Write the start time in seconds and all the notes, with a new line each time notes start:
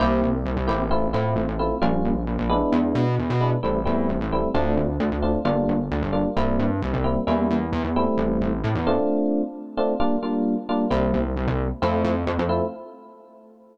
0.00 C2 A#3 C4 E4 G4
0.23 C2
0.45 C2
0.57 C2
0.68 A1 A#3 C4 E4 G4
0.91 A3 C4 E4 F4
1.13 A2 A3 C4 E4 F4
1.36 A1
1.48 A1
1.59 A3 C4 E4 F4
1.82 A#1 G3 A#3 C#4 F4
2.05 A#1
2.27 A#1
2.38 A#1
2.50 G#3 B3 D4 E4
2.72 E2
2.95 B2
3.19 E2
3.30 B2
3.41 G#3 B3 D4 E4
3.63 A1 G3 A3 C4 E4
3.85 E2 G3 A3 C4 E4
4.09 A1
4.20 A1
4.32 G3 A3 C4 E4
4.54 D2 A3 C4 D4 F4
4.77 D2
5.00 D2
5.12 D2
5.22 A3 C4 D4 F4
5.45 G1 G3 A#3 D4 F4
5.68 G1
5.91 D2
6.02 G1
6.13 G3 A#3 D4 F4
6.37 C2 G3 A#3 C4 E4
6.59 G2
6.82 C2
6.94 C2
7.04 G3 A#3 C4 E4
7.27 E2 G3 A#3 C#4 E4
7.51 E2
7.72 E2
7.84 E2
7.96 G3 A3 C4 E4
8.17 A1
8.41 A1
8.64 A2
8.75 E2
8.87 A3 C4 D4 F4
9.77 A3 C4 D4 F4
10.00 G3 A#3 D4 F4
10.23 G3 A#3 D4 F4
10.69 G3 A#3 D4 F4
10.90 C2 G3 A#3 C4 E4
11.14 C2
11.36 C2
11.47 C2
11.82 F2 A3 C4 E4 F4
12.04 F2
12.27 F2
12.39 F2
12.49 A3 C4 E4 F4